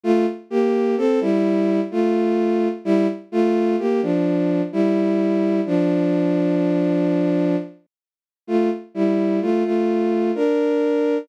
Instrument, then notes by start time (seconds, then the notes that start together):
violin
0.04 A3 F4
0.50 A#3 G4
0.97 C4 A4
1.21 G3 E4
1.91 A3 F4
2.85 G3 E4
3.32 A3 F4
3.79 A#3 G4
4.02 F3 D4
4.72 G3 E4
5.66 F3 D4
8.47 A3 F4
8.95 G3 E4
9.41 A3 F4
9.64 A3 F4
10.35 D4 A#4